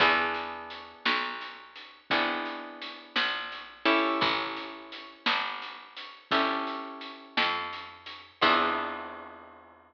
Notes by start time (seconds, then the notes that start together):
0.00 E2 B3 D4 E4 G#4, kick, closed hi-hat
0.34 closed hi-hat
0.70 closed hi-hat
1.05 B1, snare
1.41 closed hi-hat
1.76 closed hi-hat
2.10 G#1 B3 D4 E4 G#4, kick, closed hi-hat
2.45 closed hi-hat
2.82 closed hi-hat
3.16 A#1, snare
3.52 closed hi-hat
3.86 C#4 E4 G4 A4, open hi-hat
4.21 A1, kick, closed hi-hat
4.57 closed hi-hat
4.92 closed hi-hat
5.26 G1, snare
5.62 closed hi-hat
5.96 closed hi-hat
6.31 G1 C#4 E4 G4 A4, kick, closed hi-hat
6.67 closed hi-hat
7.01 closed hi-hat
7.37 F2, snare
7.73 closed hi-hat
8.06 closed hi-hat
8.42 E2 B3 D4 E4 G#4, kick, crash